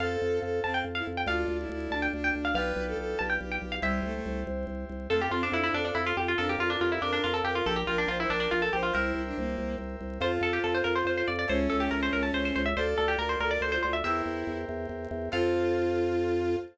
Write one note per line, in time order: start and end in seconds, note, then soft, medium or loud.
0.00 0.17 F2 loud
0.00 1.24 C4 medium
0.00 1.24 F4 medium
0.00 1.24 A4 medium
0.00 0.39 A4 medium
0.00 0.56 F5 loud
0.22 0.40 F2 medium
0.42 0.61 F2 medium
0.42 0.60 A4 medium
0.63 0.83 F2 medium
0.63 0.82 C4 medium
0.63 0.74 A5 medium
0.74 0.84 G5 medium
0.84 1.02 F2 medium
0.95 1.06 E4 medium
0.95 1.05 F5 medium
1.07 1.25 F2 medium
1.17 1.27 G5 loud
1.26 1.45 D2 medium
1.26 2.52 D4 medium
1.26 1.57 F4 medium
1.26 2.52 F4 medium
1.26 2.52 A4 medium
1.26 1.86 F5 loud
1.48 1.66 D2 medium
1.59 1.69 E4 medium
1.69 1.88 D2 medium
1.69 1.92 E4 medium
1.90 2.08 D2 medium
1.90 2.11 D4 medium
1.90 2.02 A5 loud
2.02 2.12 G5 medium
2.13 2.31 D2 medium
2.13 2.52 D4 medium
2.24 2.34 G5 loud
2.35 2.53 D2 medium
2.45 2.55 F5 loud
2.54 2.73 B1 loud
2.54 3.81 D4 medium
2.54 3.81 F4 medium
2.54 3.81 G4 medium
2.54 2.84 B4 medium
2.54 3.81 B4 medium
2.54 3.18 F5 loud
2.76 2.94 B1 medium
2.87 2.97 A4 medium
2.97 3.15 B1 medium
2.97 3.18 A4 medium
3.19 3.38 B1 medium
3.19 3.39 G4 medium
3.19 3.29 A5 medium
3.30 3.40 G5 loud
3.41 3.59 B1 medium
3.41 3.76 G4 medium
3.52 3.62 G5 medium
3.62 3.80 B1 medium
3.72 3.82 F5 loud
3.82 4.01 C2 loud
3.82 4.03 G3 medium
3.82 5.07 E4 medium
3.82 5.07 G4 medium
3.82 5.07 C5 medium
3.82 4.83 E5 loud
4.03 4.21 C2 medium
4.03 4.14 A3 medium
4.14 4.40 A3 medium
4.26 4.44 C2 medium
4.47 4.65 C2 medium
4.67 4.85 C2 medium
4.89 5.08 C2 medium
5.10 5.28 F2 medium
5.10 5.22 A3 medium
5.10 6.36 F4 medium
5.10 5.20 A4 loud
5.10 6.36 A4 medium
5.10 6.36 C5 medium
5.21 5.32 G4 loud
5.31 5.49 F2 medium
5.31 5.42 C4 medium
5.31 5.41 F4 medium
5.43 5.54 C4 medium
5.43 5.53 D4 loud
5.52 5.70 F2 medium
5.52 5.63 D4 medium
5.52 5.63 E4 loud
5.63 5.74 D4 medium
5.63 5.74 E4 loud
5.73 5.91 F2 medium
5.73 5.84 D4 loud
5.73 6.14 A4 medium
5.85 5.95 D4 medium
5.95 6.13 F2 medium
5.95 6.05 E4 loud
6.06 6.17 F4 loud
6.17 6.35 F2 medium
6.17 6.35 F4 medium
6.17 6.27 G4 medium
6.28 6.38 F4 medium
6.38 6.56 F2 medium
6.38 6.48 D4 medium
6.38 7.64 F4 medium
6.38 6.48 A4 loud
6.38 7.64 A#4 medium
6.38 7.64 D5 medium
6.49 6.59 G4 medium
6.58 6.76 F2 medium
6.58 6.70 F4 loud
6.58 6.70 F4 medium
6.70 6.80 D4 medium
6.70 6.80 F4 medium
6.80 6.99 F2 medium
6.80 6.91 F4 loud
6.80 6.90 G4 medium
6.92 7.02 E4 medium
6.92 7.02 G4 medium
7.02 7.20 F2 medium
7.02 7.12 D4 medium
7.02 7.39 A#4 medium
7.13 7.23 D4 medium
7.24 7.42 F2 medium
7.24 7.34 F4 loud
7.34 7.44 A4 loud
7.44 7.62 F2 medium
7.44 7.55 G4 loud
7.44 7.65 A#4 medium
7.55 7.65 F4 medium
7.65 7.84 A#1 loud
7.65 7.75 G4 medium
7.65 8.92 G4 medium
7.65 7.76 A4 loud
7.65 8.92 A#4 medium
7.65 8.92 D5 medium
7.76 7.86 G4 medium
7.87 8.06 A#1 medium
7.87 7.97 F4 medium
7.87 7.97 A#4 medium
7.98 8.08 D4 medium
7.98 8.09 A#4 medium
8.08 8.26 A#1 medium
8.08 8.18 F4 loud
8.08 8.18 C5 medium
8.20 8.30 E4 loud
8.20 8.30 C5 medium
8.30 8.48 A#1 medium
8.30 8.40 D4 medium
8.30 8.72 A#4 medium
8.40 8.50 D4 medium
8.51 8.70 A#1 medium
8.51 8.61 F4 loud
8.62 8.72 A4 medium
8.73 8.91 A#1 medium
8.73 8.83 G4 medium
8.73 8.94 C5 medium
8.83 8.93 F4 medium
8.93 9.13 C2 medium
8.93 9.21 E4 medium
8.93 10.18 G4 medium
8.93 10.18 A#4 medium
8.93 9.46 A#4 loud
8.93 10.18 C5 medium
8.93 10.18 E5 medium
9.15 9.33 C2 medium
9.26 9.37 D4 medium
9.37 9.56 C2 medium
9.37 9.74 A#3 medium
9.58 9.76 C2 medium
9.78 9.96 C2 medium
10.01 10.19 C2 medium
10.20 10.38 F2 loud
10.20 11.46 F4 medium
10.20 11.28 F4 medium
10.20 11.46 A4 medium
10.20 11.46 C5 medium
10.20 10.32 C5 loud
10.41 10.59 F2 medium
10.41 10.53 A4 loud
10.53 10.63 G4 medium
10.64 10.82 F2 medium
10.64 10.74 A4 loud
10.74 10.85 C5 medium
10.84 11.03 F2 medium
10.84 10.94 A#4 medium
10.95 11.06 C5 loud
11.05 11.23 F2 medium
11.05 11.17 C5 medium
11.18 11.28 C5 medium
11.28 11.46 F2 medium
11.28 11.38 D5 medium
11.39 11.49 D5 medium
11.48 11.68 C#2 loud
11.48 12.62 C#4 medium
11.48 12.73 E4 medium
11.48 12.73 A4 medium
11.48 11.59 C5 loud
11.48 12.73 C#5 medium
11.70 11.89 C#2 medium
11.70 11.80 A4 medium
11.80 11.90 G4 medium
11.91 12.10 C#2 medium
11.91 12.01 A#4 medium
12.03 12.13 C5 medium
12.13 12.31 C#2 medium
12.13 12.23 A#4 medium
12.23 12.33 A5 medium
12.33 12.52 C#2 medium
12.33 12.44 C5 medium
12.45 12.55 C5 loud
12.56 12.74 C#2 medium
12.56 12.66 C5 medium
12.66 12.76 E5 medium
12.77 12.95 D2 medium
12.77 14.03 F4 medium
12.77 13.14 A4 medium
12.77 14.03 A4 medium
12.77 12.87 C5 medium
12.77 14.03 D5 medium
12.98 13.16 D2 medium
12.98 13.08 A4 medium
13.08 13.18 G4 medium
13.18 13.36 D2 medium
13.18 13.29 A#4 loud
13.18 13.37 A#4 medium
13.29 13.39 C5 medium
13.40 13.58 D2 medium
13.40 13.51 A4 medium
13.40 13.51 A#4 loud
13.51 13.61 A#4 medium
13.51 13.61 D5 loud
13.61 13.79 D2 medium
13.61 13.73 A4 medium
13.61 13.71 C5 medium
13.72 13.82 F4 medium
13.72 13.82 C5 loud
13.83 14.02 D2 medium
13.83 13.94 F4 medium
13.83 13.93 C5 loud
13.93 14.03 E5 loud
14.04 14.22 E2 medium
14.04 14.58 E4 medium
14.04 15.30 E4 medium
14.04 15.30 G4 medium
14.04 15.30 A#4 medium
14.04 15.30 C5 medium
14.04 14.67 E5 loud
14.26 14.44 E2 medium
14.47 14.65 E2 medium
14.69 14.87 E2 medium
14.89 15.07 E2 medium
15.11 15.29 E2 medium
15.32 16.56 F2 loud
15.32 16.55 C4 loud
15.32 16.55 F4 loud
15.32 16.56 F4 loud
15.32 16.55 A4 medium
15.32 16.56 F5 loud